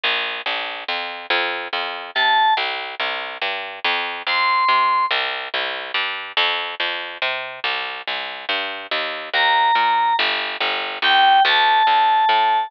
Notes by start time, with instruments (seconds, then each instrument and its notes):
0.04 electric bass (finger) A#1
0.46 electric bass (finger) A#1
0.88 electric bass (finger) F2
1.30 electric bass (finger) F2
1.73 electric bass (finger) F2
2.15 electric bass (finger) C3, electric piano 2 A5
2.57 electric bass (finger) C2
3.00 electric bass (finger) C2
3.42 electric bass (finger) G2
3.84 electric bass (finger) F2
4.27 electric bass (finger) F2, electric piano 2 C6
4.68 electric bass (finger) C3
5.11 electric bass (finger) C2
5.54 electric bass (finger) C2
5.94 electric bass (finger) G2
6.37 electric bass (finger) F2
6.80 electric bass (finger) F2
7.22 electric bass (finger) C3
7.64 electric bass (finger) C2
8.07 electric bass (finger) C2
8.49 electric bass (finger) G2
8.91 electric bass (finger) D#2
9.34 electric bass (finger) D#2, electric piano 2 A#5
9.75 electric bass (finger) A#2
10.19 electric bass (finger) G1
10.60 electric bass (finger) G1
11.02 electric bass (finger) D2, electric piano 2 G5
11.45 electric bass (finger) D2, electric piano 2 A5
11.87 electric bass (finger) D2
12.29 electric bass (finger) A2